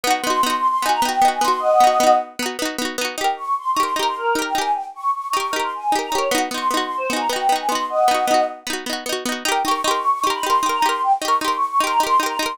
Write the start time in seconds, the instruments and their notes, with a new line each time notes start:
0.04 pizzicato strings B3 D#4, choir aahs F#5
0.10 pizzicato strings F#4
0.22 pizzicato strings B3, choir aahs C6
0.27 pizzicato strings D#4 F#4
0.43 pizzicato strings B3 D#4, choir aahs C6
0.50 pizzicato strings F#4
0.57 choir aahs C6
0.68 choir aahs C6
0.82 pizzicato strings B3 D#4, choir aahs G#5
0.89 pizzicato strings F#4, choir aahs A#5
1.02 pizzicato strings B3 D#4, choir aahs G5
1.09 pizzicato strings F#4
1.22 pizzicato strings B3 D#4
1.28 pizzicato strings F#4
1.33 choir aahs G#5
1.41 pizzicato strings B3 D#4, choir aahs C6
1.48 pizzicato strings F#4
1.59 choir aahs D#5 F#5
1.80 pizzicato strings B3 D#4
1.87 pizzicato strings F#4
2.00 pizzicato strings B3 D#4
2.07 pizzicato strings F#4
2.39 pizzicato strings B3 D#4
2.46 pizzicato strings F#4
2.59 pizzicato strings B3 D#4
2.65 pizzicato strings F#4
2.78 pizzicato strings B3 D#4
2.85 pizzicato strings F#4
2.98 pizzicato strings B3 D#4
3.05 pizzicato strings F#4
3.17 pizzicato strings D#4 G4, choir aahs G5
3.24 pizzicato strings A#4
3.37 choir aahs C#6
3.58 choir aahs C6
3.71 choir aahs C#6
3.76 pizzicato strings D#4 G4
3.81 pizzicato strings A#4, choir aahs C6
3.96 pizzicato strings D#4 G4, choir aahs A#5
4.03 pizzicato strings A#4
4.07 choir aahs C6
4.16 choir aahs A#4
4.35 pizzicato strings D#4 G4
4.42 pizzicato strings A#4, choir aahs G5
4.54 pizzicato strings D#4 G4, choir aahs G#5
4.61 pizzicato strings A#4
4.75 choir aahs G5
4.94 choir aahs C#6
5.15 choir aahs C#6
5.28 choir aahs C#6
5.33 pizzicato strings D#4 G4
5.38 pizzicato strings A#4, choir aahs C#6
5.51 pizzicato strings D#4, choir aahs A#4
5.56 pizzicato strings G4 A#4
5.62 choir aahs C6
5.75 choir aahs G#5
5.92 pizzicato strings D#4 G4
5.99 pizzicato strings A#4, choir aahs A#5
6.11 pizzicato strings D#4 G4, choir aahs C#5
6.18 pizzicato strings A#4
6.31 pizzicato strings B3 D#4, choir aahs F#5
6.38 pizzicato strings F#4
6.51 pizzicato strings B3 D#4, choir aahs C6
6.58 pizzicato strings F#4
6.68 pizzicato strings B3, choir aahs C6
6.74 pizzicato strings D#4 F#4
6.84 choir aahs C6
6.98 choir aahs C5
7.10 pizzicato strings B3 D#4, choir aahs G#5
7.16 pizzicato strings F#4, choir aahs A#5
7.29 pizzicato strings B3 D#4, choir aahs G5
7.36 pizzicato strings F#4
7.49 pizzicato strings B3 D#4
7.56 pizzicato strings F#4, choir aahs G#5
7.68 pizzicato strings B3, choir aahs C6
7.72 pizzicato strings D#4 F#4
7.89 choir aahs D#5 F#5
8.08 pizzicato strings B3 D#4
8.14 pizzicato strings F#4
8.27 pizzicato strings B3 D#4
8.34 pizzicato strings F#4
8.67 pizzicato strings B3 D#4
8.73 pizzicato strings F#4
8.86 pizzicato strings B3 D#4
8.93 pizzicato strings F#4
9.06 pizzicato strings B3 D#4
9.13 pizzicato strings F#4
9.25 pizzicato strings B3 D#4
9.32 pizzicato strings F#4
9.45 pizzicato strings D#4 G4, choir aahs G5
9.52 pizzicato strings A#4
9.65 pizzicato strings D#4 G4, choir aahs C#6
9.71 pizzicato strings A#4
9.83 pizzicato strings D#4, choir aahs C6
9.88 pizzicato strings G4 A#4
9.97 choir aahs C#6
10.10 choir aahs C#6
10.22 pizzicato strings D#4, choir aahs C6
10.27 pizzicato strings G4 A#4
10.34 choir aahs B5
10.43 pizzicato strings D#4 G4, choir aahs C6
10.50 pizzicato strings A#4
10.63 pizzicato strings D#4 G4
10.69 pizzicato strings A#4, choir aahs A#5
10.82 pizzicato strings D#4 G4, choir aahs C6
10.89 pizzicato strings A#4
11.03 choir aahs G5
11.21 pizzicato strings D#4, choir aahs C#6
11.25 pizzicato strings G4 A#4
11.41 pizzicato strings D#4 G4, choir aahs C6
11.48 pizzicato strings A#4
11.56 choir aahs C#6
11.67 choir aahs C#6
11.80 pizzicato strings D#4 G4, choir aahs C6
11.87 pizzicato strings A#4, choir aahs A#5
12.00 pizzicato strings D#4 G4, choir aahs C6
12.07 pizzicato strings A#4
12.20 pizzicato strings D#4 G4
12.26 pizzicato strings A#4, choir aahs A#5
12.39 pizzicato strings D#4 G4, choir aahs C6
12.46 pizzicato strings A#4